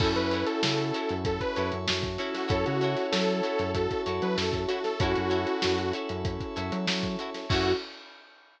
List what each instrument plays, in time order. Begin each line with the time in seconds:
0.00 synth bass 1 F#2, electric piano 2 C#4 E4 F#4 A4, violin E4, acoustic guitar (steel) E4 F#4 A4 C#5, lead 2 (sawtooth) A4, pad 5 (bowed) C#5 E5 F#5 A5, kick, crash
0.16 synth bass 1 F#2, lead 2 (sawtooth) B4, snare, closed hi-hat
0.31 acoustic guitar (steel) E4 F#4 A4 C#5, closed hi-hat
0.46 lead 2 (sawtooth) A4, closed hi-hat
0.63 synth bass 1 C#3, lead 2 (sawtooth) A4, snare
0.78 closed hi-hat
0.94 acoustic guitar (steel) E4 F#4 A4 C#5, closed hi-hat
1.09 synth bass 1 F#2, closed hi-hat
1.23 lead 2 (sawtooth) A4, pad 5 (bowed) C#5 E5 A5 C#6, kick, closed hi-hat
1.40 lead 2 (sawtooth) B4, kick, closed hi-hat
1.56 synth bass 1 F#2, acoustic guitar (steel) E4 F#4 A4 C#5, closed hi-hat
1.72 synth bass 1 F#2, closed hi-hat
1.88 synth bass 1 F#2, violin F#4, snare
2.03 kick, snare, closed hi-hat
2.18 electric piano 2 C#4 E4 F#4 A4, acoustic guitar (steel) E4 F#4 A4 C#5, snare, closed hi-hat
2.34 lead 2 (sawtooth) F#4, snare, closed hi-hat
2.48 synth bass 1 F#2, acoustic guitar (steel) E4 F#4 A4 C#5, lead 2 (sawtooth) A4, violin C#5, pad 5 (bowed) C#5 E5 F#5 A5, kick, closed hi-hat
2.65 synth bass 1 C#3, lead 2 (sawtooth) F#4, closed hi-hat
2.81 acoustic guitar (steel) E4 F#4 A4 C#5, violin C#5, snare, closed hi-hat
2.97 snare, closed hi-hat
3.12 synth bass 1 F#3, lead 2 (sawtooth) A4, snare
3.28 closed hi-hat
3.43 acoustic guitar (steel) E4 F#4 A4 C#5, closed hi-hat
3.59 synth bass 1 F#2, closed hi-hat
3.74 violin F#4, lead 2 (sawtooth) A4, pad 5 (bowed) C#5 E5 A5 C#6, kick, closed hi-hat
3.91 kick, closed hi-hat
4.06 synth bass 1 F#2, acoustic guitar (steel) E4 F#4 A4 C#5, closed hi-hat
4.22 synth bass 1 F#3, lead 2 (sawtooth) B4, closed hi-hat
4.37 synth bass 1 F#2, lead 2 (sawtooth) A4, snare
4.53 kick, closed hi-hat
4.68 acoustic guitar (steel) E4 F#4 A4 C#5, lead 2 (sawtooth) F#4, snare, closed hi-hat
4.84 lead 2 (sawtooth) A4, snare, closed hi-hat
4.99 synth bass 1 F#2, electric piano 2 C#4 E4 F#4 A4, violin E4, acoustic guitar (steel) E4 F#4 A4 C#5, lead 2 (sawtooth) F#4, pad 5 (bowed) C#5 E5 F#5 A5, kick, closed hi-hat
5.16 synth bass 1 F#2, closed hi-hat
5.30 acoustic guitar (steel) E4 F#4 A4 C#5, closed hi-hat
5.47 closed hi-hat
5.62 synth bass 1 F#2, snare
5.78 closed hi-hat
5.93 acoustic guitar (steel) E4 F#4 A4 C#5, closed hi-hat
6.09 synth bass 1 F#2, closed hi-hat
6.25 pad 5 (bowed) C#5 E5 A5 C#6, kick, closed hi-hat
6.40 kick, closed hi-hat
6.56 synth bass 1 F#2, acoustic guitar (steel) E4 F#4 A4 C#5, closed hi-hat
6.72 synth bass 1 F#3, closed hi-hat
6.87 synth bass 1 F#3, snare
7.03 kick, closed hi-hat
7.19 acoustic guitar (steel) E4 F#4 A4 C#5, closed hi-hat
7.34 snare, closed hi-hat
7.49 synth bass 1 F#2, electric piano 2 C#4 E4 F#4 A4, pad 5 (bowed) C#4 E4 F#4 A4, acoustic guitar (steel) E4 F#4 A4 C#5, violin F#4, lead 2 (sawtooth) F#4, kick, crash